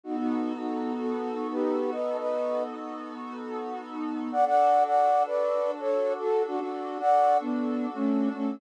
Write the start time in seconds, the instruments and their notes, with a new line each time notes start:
0.03 pad 5 (bowed) B3 D#4 F#4 A4, flute D#4 F#4
0.17 flute D#4 F#4
0.57 flute D#4 F#4
0.98 flute F#4 A4
1.51 flute G4 B4
1.91 flute B4 D#5
2.18 flute B4 D#5
4.32 pad 5 (bowed) D4 F#4 A4, flute D5 F#5
4.46 flute D5 F#5
4.86 flute D5 F#5
5.26 flute B4 D5
5.80 flute A4 C#5
6.20 flute F#4 A4
6.47 flute D4 F#4
6.60 flute D4 F#4
7.00 flute D5 F#5
7.40 flute B3 D4
7.94 flute A3 C#4
8.34 flute A3 C#4